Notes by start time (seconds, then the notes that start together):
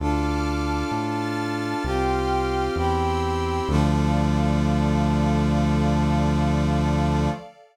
0.00 D2 D4 F4 A4 A5 D6 F6
0.91 A2 A5 F6 A6
1.84 C2 C4 F4 G4 G5 C6 F6
2.76 E2 C4 E4 G4 G5 C6 E6
3.68 D2 D3 F3 A3 A4 D5 F5